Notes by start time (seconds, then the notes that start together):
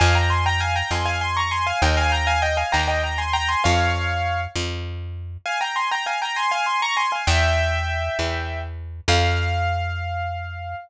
0.00 F2 F5 G#5
0.15 G5 A#5
0.30 G#5 C6
0.46 G5 A#5
0.60 F5 G#5
0.76 G5 A#5
0.91 F2 G#5 C6
1.06 F5 G#5
1.21 G#5 C6
1.37 A#5 C#6
1.51 G#5 C6
1.67 F5 G#5
1.82 D#2 D#5 G5
1.97 F5 G#5
2.12 G5 A#5
2.27 F5 G#5
2.42 D#5 G5
2.57 F5 G#5
2.72 D#2 G5 A#5
2.88 D#5 G5
3.03 G5 A#5
3.18 G#5 C6
3.33 G5 A#5
3.48 G#5 C6
3.64 F2 C#5 F5
4.56 F2
5.46 F5 G#5
5.61 G5 A#5
5.76 G#5 C6
5.91 G5 A#5
6.06 F5 G#5
6.22 G5 A#5
6.36 G#5 C6
6.51 F5 G#5
6.66 G#5 C6
6.82 A#5 C#6
6.97 G#5 C6
7.12 F5 G#5
7.27 E2 E5 G5
8.19 E2
9.08 F2 F5